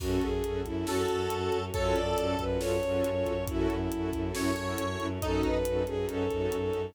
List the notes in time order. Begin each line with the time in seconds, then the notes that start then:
0.00 F#2 C#4 F#4 A4, kick, crash
0.21 F#2 G#4, kick, closed hi-hat
0.34 C#4 F#4 A4
0.43 F#2 C#4 F#4 A4, closed hi-hat
0.65 F#2 C#4 E4 F#4 A4, kick, closed hi-hat
0.76 C#4 F#4 A4
0.86 F#2 C#4 F#4 A4 C#5, snare
1.09 F#2 C#4 F#4 A4, closed hi-hat
1.30 F#2, closed hi-hat
1.41 C#4 F#4 A4
1.52 F#2, closed hi-hat
1.62 C#4 F#4 A4
1.73 F#2 C#4 F4 F#4 A4 C#5, kick, closed hi-hat
1.94 F#2 D5, closed hi-hat
2.07 C#4 F4 F#4 A4
2.17 F#2 C#4 F4 F#4 A4, closed hi-hat
2.39 F#2 C#4 F4 F#4 A4 B4, kick, closed hi-hat
2.50 C#4 F4 F#4 A4
2.59 F#2 C#4 F4 A4 C#5, snare
2.83 F#2 C#4 F4 F#4 A4, closed hi-hat
3.04 F#2, closed hi-hat
3.16 C#4 F4 F#4 A4
3.26 F#2, kick, closed hi-hat
3.37 C#4 F4 F#4 A4
3.48 F#2 C#4 E4 F#4 A4, kick, closed hi-hat
3.69 F#2, closed hi-hat
3.80 C#4 E4 F#4 A4
3.91 F#2 C#4 E4 F#4 A4, closed hi-hat
4.13 F#2 C#4 E4 F#4 A4, kick, closed hi-hat
4.25 C#4 E4 F#4 A4
4.35 F#2 C#4 E4 A4 C#5, snare
4.56 F#2 C#4 E4 F#4 A4, closed hi-hat
4.78 F#2, closed hi-hat
4.90 C#4 E4 F#4 A4
5.00 F#2, closed hi-hat
5.10 C#4 E4 F#4 A4
5.21 F#2 C#4 D#4 F#4 A4, kick, closed hi-hat
5.43 F#2 B4, kick, closed hi-hat
5.55 C#4 D#4 F#4 A4
5.65 F#2 C#4 D#4 F#4 A4, closed hi-hat
5.86 F#2 C#4 D#4 F#4 G#4 A4, closed hi-hat
5.97 C#4 D#4 F#4 A4
6.09 F#2 C#4 D#4 A4 C#5, closed hi-hat
6.30 F#2 C#4 D#4 F#4 A4, kick, closed hi-hat
6.52 F#2, closed hi-hat
6.62 C#4 D#4 F#4 A4
6.73 F#2, closed hi-hat
6.85 C#4 D#4 F#4 A4